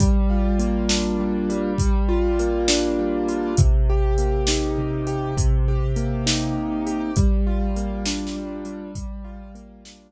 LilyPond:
<<
  \new Staff \with { instrumentName = "Acoustic Grand Piano" } { \time 12/8 \key g \minor \tempo 4. = 67 g8 f'8 bes8 d'8 g8 g4 f'8 bes8 d'8 g8 f'8 | c8 g'8 bes8 ees'8 c8 g'8 c8 g'8 bes8 ees'8 c8 g'8 | g8 f'8 bes8 d'8 g8 g4 f'8 bes8 d'8 r4 | }
  \new DrumStaff \with { instrumentName = "Drums" } \drummode { \time 12/8 <hh bd>4 hh8 sn4 hh8 <hh bd>4 hh8 sn4 hh8 | <hh bd>4 hh8 sn4 hh8 <hh bd>4 hh8 sn4 hh8 | <hh bd>4 hh8 \tuplet 3/2 { sn16 r16 sn16 r16 r16 r16 hh16 r16 r16 } <hh bd>4 hh8 sn4. | }
>>